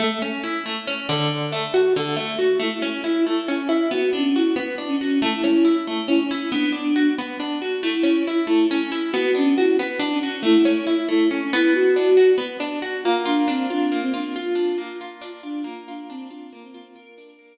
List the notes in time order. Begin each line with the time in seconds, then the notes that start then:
0.00 A3
0.22 C#4
0.44 E4
0.66 A3
0.87 C#4
1.09 D3
1.52 A3
1.74 F#4
1.96 D3
2.17 A3
2.39 F#4
2.60 A3 E4
2.82 C#4
3.04 E4
3.27 A3 E4
3.48 C#4 E4
3.60 C#4
3.69 E4
3.91 B3 F#4
4.13 C#4 D4
4.35 E4 F#4
4.56 B3
4.78 D4
4.88 C#4
5.00 C#4 F#4
5.21 A3 E4
5.44 C#4
5.65 E4
5.87 A3 E4
6.08 C#4 E4
6.20 C#4
6.31 C#4 E4
6.51 B3 D4
6.72 D4
6.96 F#4
7.18 B3
7.40 D4
7.62 F#4
7.82 A3 E4
8.03 C#4
8.27 E4
8.47 A3 E4
8.71 C#4 E4
8.81 C#4
8.90 E4
9.12 B3 F#4
9.35 C#4 D4
9.56 E4 F#4
9.79 B3
9.99 D4
10.11 C#4
10.22 C#4 F#4
10.43 A3 E4
10.65 C#4
10.87 E4
11.09 A3 E4
11.29 C#4 E4
11.42 C#4
11.53 B3 E4
11.74 F#4
11.96 D4
12.17 F#4
12.38 B3
12.60 D4
12.82 F#4
13.04 A#3 F4
13.26 D4 F4
13.47 C4 D4
13.70 D4 F4
13.92 A#3
14.02 C4
14.14 D4 F4
14.34 F4
14.55 D4
14.78 A#3
15.01 F4
15.21 D4 F4
15.43 D4 F4
15.63 A#3 F4
15.88 D4 F4
16.09 C4 D4
16.29 D4 F4
16.53 A#3
16.62 C4
16.72 C4 F4
16.96 F4 A#4
17.18 D4
17.39 A#3